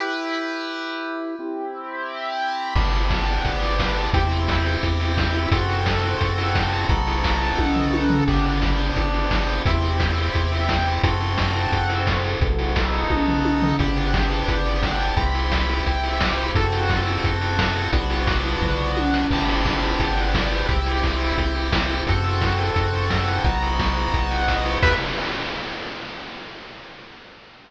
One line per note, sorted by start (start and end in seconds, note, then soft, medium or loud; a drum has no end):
0.00 1.35 E4 medium
0.00 1.35 G4 medium
0.00 1.35 B4 medium
1.39 2.74 C4 medium
1.39 2.74 E4 medium
1.39 2.74 G4 medium
2.75 3.39 G1 loud
2.75 4.10 B3 medium
2.75 4.10 D4 medium
2.75 4.10 G4 medium
2.75 kick loud
2.75 crash medium
2.93 open hi-hat medium
3.10 kick medium
3.10 snare loud
3.28 open hi-hat medium
3.45 4.08 G1 medium
3.45 kick medium
3.45 closed hi-hat loud
3.62 open hi-hat medium
3.79 kick medium
3.79 snare loud
3.97 open hi-hat medium
4.14 4.77 E2 loud
4.14 5.49 C4 medium
4.14 5.49 E4 medium
4.14 5.49 G4 medium
4.14 kick loud
4.14 closed hi-hat loud
4.31 open hi-hat medium
4.48 kick medium
4.48 snare loud
4.65 open hi-hat medium
4.83 5.47 E2 medium
4.83 kick medium
4.83 closed hi-hat loud
5.00 open hi-hat medium
5.17 kick medium
5.17 snare loud
5.34 open hi-hat medium
5.51 6.15 F#2 loud
5.51 6.87 C4 medium
5.51 6.87 F#4 medium
5.51 6.87 A4 medium
5.51 kick loud
5.51 closed hi-hat loud
5.69 open hi-hat medium
5.86 kick medium
5.86 snare loud
6.04 open hi-hat medium
6.21 6.85 F#2 medium
6.21 kick medium
6.21 closed hi-hat loud
6.38 open hi-hat medium
6.55 kick medium
6.55 snare loud
6.73 open hi-hat medium
6.89 7.53 B1 loud
6.89 8.24 B3 medium
6.89 8.24 D#4 medium
6.89 8.24 F#4 medium
6.89 8.24 A4 medium
6.89 kick loud
6.89 closed hi-hat loud
7.07 open hi-hat medium
7.24 kick medium
7.24 snare loud
7.41 open hi-hat medium
7.58 8.22 B1 medium
7.58 kick medium
7.58 high tom medium
7.76 floor tom medium
7.93 high tom medium
8.10 floor tom loud
8.28 8.92 G1 loud
8.28 9.63 B3 medium
8.28 9.63 D4 medium
8.28 9.63 G4 medium
8.28 kick loud
8.28 crash medium
8.45 open hi-hat medium
8.62 kick medium
8.62 snare loud
8.79 open hi-hat medium
8.96 9.61 G1 medium
8.96 kick medium
8.96 closed hi-hat loud
9.14 open hi-hat medium
9.31 kick medium
9.31 snare loud
9.48 open hi-hat medium
9.65 10.29 E2 loud
9.65 11.02 C4 medium
9.65 11.02 E4 medium
9.65 11.02 G4 medium
9.65 kick loud
9.65 closed hi-hat loud
9.83 open hi-hat medium
10.00 kick medium
10.00 snare loud
10.17 open hi-hat medium
10.35 10.99 E2 medium
10.35 kick medium
10.35 closed hi-hat loud
10.52 open hi-hat medium
10.69 kick medium
10.69 snare loud
10.86 open hi-hat medium
11.03 11.67 F#2 loud
11.03 12.39 C4 medium
11.03 12.39 F#4 medium
11.03 12.39 A4 medium
11.03 kick loud
11.03 closed hi-hat loud
11.21 open hi-hat medium
11.38 kick medium
11.38 snare loud
11.55 open hi-hat medium
11.72 12.36 F#2 medium
11.72 kick medium
11.72 closed hi-hat loud
11.89 open hi-hat medium
12.07 kick medium
12.07 snare loud
12.24 open hi-hat medium
12.41 13.04 B1 loud
12.41 13.77 B3 medium
12.41 13.77 D#4 medium
12.41 13.77 F#4 medium
12.41 13.77 A4 medium
12.41 kick loud
12.41 closed hi-hat loud
12.59 open hi-hat medium
12.76 kick medium
12.76 snare loud
12.93 open hi-hat medium
13.10 13.74 B1 medium
13.10 kick medium
13.10 high tom medium
13.28 floor tom medium
13.45 high tom medium
13.62 floor tom loud
13.79 14.43 G1 loud
13.79 15.15 B3 medium
13.79 15.15 D4 medium
13.79 15.15 G4 medium
13.79 kick loud
13.79 closed hi-hat loud
13.96 open hi-hat medium
14.14 kick medium
14.14 snare loud
14.31 open hi-hat medium
14.48 15.11 G1 medium
14.48 kick medium
14.48 closed hi-hat loud
14.66 open hi-hat medium
14.83 kick medium
14.83 snare loud
15.00 open hi-hat medium
15.17 15.80 C2 loud
15.17 16.52 C4 medium
15.17 16.52 E4 medium
15.17 16.52 G4 medium
15.17 kick loud
15.17 closed hi-hat loud
15.34 open hi-hat medium
15.52 kick medium
15.52 snare loud
15.69 open hi-hat medium
15.86 16.50 C2 medium
15.86 kick medium
15.86 closed hi-hat medium
16.04 open hi-hat medium
16.21 kick medium
16.21 snare loud
16.38 open hi-hat medium
16.55 17.18 F#2 medium
16.55 17.91 C4 medium
16.55 17.91 F#4 medium
16.55 17.91 A4 medium
16.55 kick loud
16.55 closed hi-hat loud
16.73 open hi-hat medium
16.90 kick medium
16.90 snare loud
17.07 open hi-hat medium
17.24 17.88 F#2 medium
17.24 kick medium
17.24 closed hi-hat loud
17.41 open hi-hat medium
17.59 kick medium
17.59 snare loud
17.76 open hi-hat medium
17.92 18.56 B1 loud
17.92 19.27 B3 medium
17.92 19.27 D4 medium
17.92 19.27 F#4 medium
17.92 kick medium
17.92 closed hi-hat loud
18.10 open hi-hat medium
18.27 kick loud
18.27 snare loud
18.45 open hi-hat medium
18.62 19.25 B1 medium
18.62 kick medium
18.62 floor tom medium
18.97 high tom medium
19.14 snare medium
19.31 19.94 G1 medium
19.31 20.68 B3 medium
19.31 20.68 D4 medium
19.31 20.68 G4 medium
19.31 kick medium
19.31 crash loud
19.48 open hi-hat medium
19.65 kick medium
19.65 snare loud
19.83 open hi-hat medium
20.00 20.63 G1 loud
20.00 kick medium
20.00 closed hi-hat loud
20.17 open hi-hat medium
20.34 kick medium
20.34 snare loud
20.51 open hi-hat medium
20.68 21.32 C2 loud
20.68 22.03 C4 medium
20.68 22.03 E4 medium
20.68 22.03 G4 medium
20.68 kick loud
20.68 closed hi-hat medium
20.86 open hi-hat medium
21.03 kick medium
21.03 snare medium
21.21 open hi-hat medium
21.38 22.01 C2 medium
21.38 kick medium
21.38 closed hi-hat loud
21.55 open hi-hat medium
21.72 kick medium
21.72 snare loud
21.90 open hi-hat medium
22.07 22.71 F#2 loud
22.07 23.44 C4 medium
22.07 23.43 F#4 medium
22.07 23.44 A4 medium
22.07 kick loud
22.07 closed hi-hat loud
22.24 open hi-hat medium
22.41 kick medium
22.41 snare loud
22.58 open hi-hat medium
22.76 23.39 F#2 medium
22.76 kick medium
22.76 closed hi-hat loud
22.93 kick medium
22.93 open hi-hat medium
23.10 kick medium
23.10 snare loud
23.28 open hi-hat medium
23.44 24.08 B1 loud
23.44 24.79 B3 medium
23.44 24.79 D#4 medium
23.44 24.79 F#4 medium
23.44 kick loud
23.44 closed hi-hat medium
23.62 open hi-hat medium
23.79 kick medium
23.79 snare loud
23.97 open hi-hat medium
24.14 24.78 B1 medium
24.14 kick medium
24.14 closed hi-hat medium
24.31 open hi-hat medium
24.48 kick medium
24.48 snare loud
24.66 open hi-hat medium
24.82 24.96 E2 loud
24.82 24.95 G4 loud
24.82 24.95 B4 loud
24.82 24.95 E5 loud
24.82 kick loud
24.82 crash loud